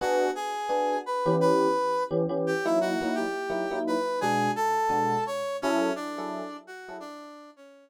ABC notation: X:1
M:4/4
L:1/8
Q:"Swing" 1/4=171
K:Bm
V:1 name="Brass Section"
[Ff]2 [^G^g]4 [Bb]2 | [Bb]4 z2 [Gg] [Ee] | [Ff]2 [Gg]4 [Bb]2 | [^G^g]2 [Aa]4 [cc']2 |
[Cc]2 [Dd]4 [Ff]2 | [Dd]3 [Cc]2 z3 |]
V:2 name="Electric Piano 1"
[B,DF^G]4 [B,DFG]3 [E,B,C=G]- | [E,B,CG]4 [E,B,CG] [E,B,CG]2 [F,^A,^DE]- | [F,^A,^DE] [F,A,DE]3 [F,A,DE] [F,A,DE]3 | [B,,^G,DF]4 [B,,G,DF]4 |
[F,E^GA]3 [F,EGA]4 [F,EGA] | z8 |]